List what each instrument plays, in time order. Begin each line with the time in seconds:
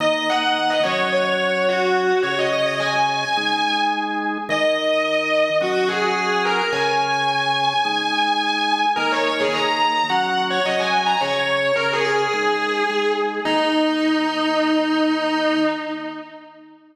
0.00 drawbar organ D#3 A#3 D#4, distortion guitar D#5
0.30 distortion guitar F#5
0.70 distortion guitar D#5
0.83 drawbar organ F#3 C#4 F#4, distortion guitar C#5
1.13 distortion guitar C#5
1.69 distortion guitar F#4
2.23 drawbar organ C#3 C#4 G#4, distortion guitar C#5
2.39 distortion guitar D#5
2.52 distortion guitar D#5
2.66 distortion guitar D#5
2.80 distortion guitar G#5
3.37 drawbar organ G#3 D#4 G#4
4.49 drawbar organ D#3 D#4 A#4, distortion guitar D#5
5.61 drawbar organ F#3 C#4 F#4, distortion guitar F#4
5.88 distortion guitar G#4
6.45 distortion guitar A#4
6.73 drawbar organ C#3 C#4 G#4, distortion guitar G#5
7.85 drawbar organ G#3 D#4 G#4
8.96 drawbar organ D#3 A#3 D#4, distortion guitar A#4
9.12 distortion guitar C#5
9.26 distortion guitar C#5
9.40 distortion guitar G#4
9.53 drawbar organ D#3 A#3 D#4, distortion guitar A#5
10.09 drawbar organ F#3 C#4 F#4, distortion guitar F#5
10.50 distortion guitar C#5
10.66 drawbar organ F#3 C#4 F#4, distortion guitar D#5
10.80 distortion guitar G#5
11.06 distortion guitar A#5
11.21 drawbar organ C#3 C#4 G#4, distortion guitar C#5
11.76 drawbar organ C#3 C#4 G#4, distortion guitar A#4
11.93 distortion guitar G#4
12.05 distortion guitar G#4
12.33 drawbar organ G#3 D#4 G#4
12.90 drawbar organ G#3 D#4 G#4
13.45 drawbar organ D#3 A#3 D#4, distortion guitar D#4